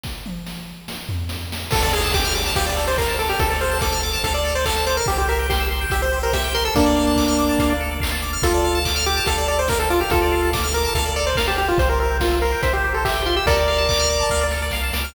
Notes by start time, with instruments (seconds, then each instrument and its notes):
0.03 kick, snare
0.26 high tom
0.47 snare
0.88 snare
1.09 floor tom
1.29 snare
1.52 snare
1.71 synth bass 1 D2, lead 1 (square) A4, kick, crash
1.82 lead 1 (square) A4 D5
1.93 lead 1 (square) G#4 F5
2.03 lead 1 (square) A5
2.12 lead 1 (square) G4 D6, kick, clap
2.25 lead 1 (square) F6
2.35 lead 1 (square) D6
2.46 lead 1 (square) A5
2.56 synth bass 1 D2, lead 1 (square) G4 F5, kick, closed hi-hat
2.66 lead 1 (square) D5
2.77 lead 1 (square) A4
2.87 lead 1 (square) C5 D5
2.98 lead 1 (square) A#4 F5, kick, clap
3.08 lead 1 (square) A5
3.19 lead 1 (square) A4 D6
3.29 lead 1 (square) G4 F6
3.39 synth bass 1 D2, lead 1 (square) A4, kick, closed hi-hat
3.50 lead 1 (square) A4 D5
3.61 lead 1 (square) C5 F5
3.71 lead 1 (square) A5
3.81 lead 1 (square) A4 D6, kick, snare
3.92 lead 1 (square) F6
4.03 lead 1 (square) D6
4.13 lead 1 (square) A5
4.24 synth bass 1 D2, lead 1 (square) A4 F5, kick, closed hi-hat
4.34 lead 1 (square) D5
4.45 lead 1 (square) A4
4.55 lead 1 (square) C5 D5
4.65 lead 1 (square) A4 F5, kick, clap
4.76 lead 1 (square) A5
4.87 lead 1 (square) C5 D6
4.97 lead 1 (square) A#4 F6
5.06 synth bass 1 C2, lead 1 (square) G4, kick, closed hi-hat
5.18 lead 1 (square) G4 C5
5.28 lead 1 (square) A#4 E5
5.39 lead 1 (square) G5
5.49 lead 1 (square) G4 C6, kick, snare
5.60 lead 1 (square) E6
5.71 lead 1 (square) C6
5.81 lead 1 (square) G5
5.90 synth bass 1 C2, lead 1 (square) G4 E5, kick, closed hi-hat
6.02 lead 1 (square) C5
6.13 lead 1 (square) G4
6.23 lead 1 (square) A#4 C5
6.33 lead 1 (square) G4 E5, kick, snare
6.44 lead 1 (square) G5
6.55 lead 1 (square) A#4 C6
6.65 lead 1 (square) A4 E6
6.75 synth bass 1 D2, lead 1 (square) A#3 D4 A4, kick, closed hi-hat
6.86 lead 1 (square) D5
6.96 lead 1 (square) F5
7.07 lead 1 (square) A5
7.16 lead 1 (square) D6, kick, clap
7.28 lead 1 (square) F6
7.39 lead 1 (square) D6
7.49 lead 1 (square) A5
7.59 synth bass 1 D2, lead 1 (square) F5, kick, closed hi-hat
7.70 lead 1 (square) D5
7.80 lead 1 (square) A4
7.91 lead 1 (square) D5
8.00 lead 1 (square) F5, kick, clap
8.12 lead 1 (square) A5
8.22 lead 1 (square) D6
8.33 lead 1 (square) F6
8.42 synth bass 1 D2, lead 1 (square) F4 A4, kick, closed hi-hat
8.54 lead 1 (square) D5
8.64 lead 1 (square) F5
8.75 lead 1 (square) A5
8.85 lead 1 (square) D6, kick, clap
8.96 lead 1 (square) F6
9.06 lead 1 (square) G4 D6
9.17 lead 1 (square) A5
9.26 synth bass 1 D2, lead 1 (square) A4 F5, kick, closed hi-hat
9.38 lead 1 (square) D5
9.48 lead 1 (square) A4 D5
9.59 lead 1 (square) C5 D5
9.68 lead 1 (square) A#4 F5, kick, snare
9.80 lead 1 (square) A4 A5
9.90 lead 1 (square) F4 D6
10.01 lead 1 (square) G4 F6
10.10 synth bass 1 D2, lead 1 (square) F4 A4, kick, closed hi-hat
10.22 lead 1 (square) D5
10.32 lead 1 (square) F5
10.43 lead 1 (square) A5
10.53 lead 1 (square) D6, kick, snare
10.64 lead 1 (square) F6
10.74 lead 1 (square) A#4 D6
10.85 lead 1 (square) A5
10.95 synth bass 1 D2, lead 1 (square) A4 F5, kick, closed hi-hat
11.06 lead 1 (square) D5
11.16 lead 1 (square) A4 D5
11.27 lead 1 (square) C5 D5
11.35 lead 1 (square) A#4 F5, kick, snare
11.48 lead 1 (square) G4 A5
11.58 lead 1 (square) G4
11.68 lead 1 (square) F4
11.78 synth bass 1 C2, lead 1 (square) C5, kick, closed hi-hat
11.89 lead 1 (square) A#4 C5
12.00 lead 1 (square) A#4 E5
12.11 lead 1 (square) G5
12.20 lead 1 (square) F4 C6, kick, snare
12.32 lead 1 (square) E6
12.42 lead 1 (square) A#4 C6
12.52 lead 1 (square) G5
12.63 synth bass 1 C2, lead 1 (square) C5 E5, kick, closed hi-hat
12.73 lead 1 (square) G4 C5
12.84 lead 1 (square) G4
12.94 lead 1 (square) A4 C5
13.05 lead 1 (square) G4 E5, kick, clap
13.15 lead 1 (square) G5
13.26 lead 1 (square) F4 C6
13.36 lead 1 (square) G4 E6
13.46 synth bass 1 D2, lead 1 (square) A4 A#4 D5, kick, closed hi-hat
13.58 lead 1 (square) D5
13.68 lead 1 (square) F5
13.78 lead 1 (square) A5
13.89 lead 1 (square) D6, kick, clap
13.99 lead 1 (square) F6
14.10 lead 1 (square) D6
14.20 lead 1 (square) A5
14.30 synth bass 1 D2, lead 1 (square) F5, kick, snare
14.41 lead 1 (square) D5
14.51 lead 1 (square) A4, snare
14.62 lead 1 (square) D5
14.71 synth bass 1 C2, lead 1 (square) F5, snare
14.83 lead 1 (square) A5
14.93 synth bass 1 C#2, lead 1 (square) D6, snare
15.04 lead 1 (square) F6